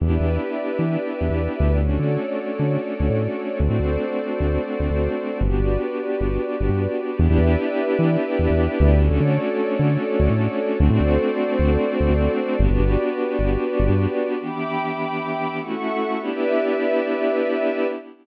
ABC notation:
X:1
M:9/8
L:1/16
Q:3/8=100
K:Edor
V:1 name="Pad 2 (warm)"
[B,DEG]18 | [A,CDF]18 | [A,=CDF]18 | [B,DFG]18 |
[B,DEG]18 | [A,CDF]18 | [A,=CDF]18 | [B,DFG]18 |
[E,B,DG]12 [A,CEF]6 | [B,DEG]18 |]
V:2 name="Pad 2 (warm)"
[GBde]18 | [FAcd]18 | [FA=cd]18 | [FGBd]18 |
[GBde]18 | [FAcd]18 | [FA=cd]18 | [FGBd]18 |
[egbd']12 [Aefc']6 | [GBde]18 |]
V:3 name="Synth Bass 1" clef=bass
E,, E,, E,,6 E,4 E,, E,,3 D,,2- | D,, D,, D,6 D,4 D,, A,,5 | D,, A,, D,,6 D,,4 D,, D,,5 | G,,, G,,, G,,,6 G,,,4 G,,, G,,5 |
E,, E,, E,,6 E,4 E,, E,,3 D,,2- | D,, D,, D,6 D,4 D,, A,,5 | D,, A,, D,,6 D,,4 D,, D,,5 | G,,, G,,, G,,,6 G,,,4 G,,, G,,5 |
z18 | z18 |]